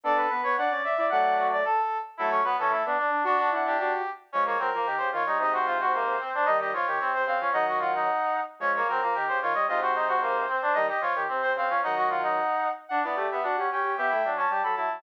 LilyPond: <<
  \new Staff \with { instrumentName = "Brass Section" } { \time 2/2 \key d \major \tempo 2 = 112 d''8 b'4 cis''8 d''4 e''4 | <d'' fis''>4. d''8 a'4. r8 | a'8 cis''8 b'8 a'8 a'8 r4. | <d' fis'>4 fis''8 g'2 r8 |
\key des \major des''8 des''8 bes'4. c''8 des''4 | ees''8 c''2.~ c''8 | ees''8 ees''8 des''4. c''8 f''4 | <ees'' ges''>4 ges''2~ ges''8 r8 |
des''8 des''8 bes'4. c''8 des''4 | ees''8 c''2.~ c''8 | ees''8 ees''8 des''8. r8. c''8 f''4 | <ees'' ges''>4 ges''2~ ges''8 r8 |
\key d \major fis''8 d''4 e''8 fis''4 g''4 | <e'' g''>4. a''4 b''8 a''4 | }
  \new Staff \with { instrumentName = "Brass Section" } { \time 2/2 \key d \major a'4 b'4 fis''8 d''4 d''8 | fis''4 fis'8 d''8 a'8 r4. | e'8 cis'8 b8 cis'8 e'8 d'8 d'4 | d'8 d'4 d'8 d'8 r4. |
\key des \major des'8 bes8 c'8 bes8 g'4 f'8 ees'8 | ees'8 ges'8 f'8 ges'8 bes4 c'8 d'8 | ees'8 g'8 f'8 g'8 c'4 c'8 des'8 | ees'8 ges'8 f'8 ees'2 r8 |
des'8 bes8 c'8 bes8 g'4 f'8 ees''8 | f'8 ges'8 ees'8 ges'8 bes4 c'8 d'8 | ees'8 g'8 f'8 g'8 c'4 c'8 des'8 | ees'8 ges'8 f'8 ees'2 r8 |
\key d \major d'8 b8 a8 b8 d'8 cis'8 cis'4 | g'8 e'8 d'8 cis'8 g'8 a'8 e'4 | }
  \new Staff \with { instrumentName = "Brass Section" } { \time 2/2 \key d \major <b d'>4 b8 b8 d'8 cis'8 r8 e'8 | <fis a>2 r2 | <fis a>4 fis8 e8 a8 b8 r8 d'8 | fis'8 d'8 e'4 fis'4 r4 |
\key des \major <f aes>4 ges8 f8 ees8 des8 ees8 g8 | <aes, c>2. r4 | <ees g>4 f8 ees8 c8 c8 des8 f8 | <ees ges>2~ <ees ges>8 r4. |
<f aes>4 ges8 f8 ees8 des8 ees8 g8 | <aes, c>2. r4 | <ees g>8 r8 f8 ees8 c8 c8 des8 f8 | <ees ges>2~ <ees ges>8 r4. |
\key d \major d'8 e'8 g'4 fis'8 g'8 g'8 g'8 | b8 a8 fis4 g8 fis8 fis8 fis8 | }
>>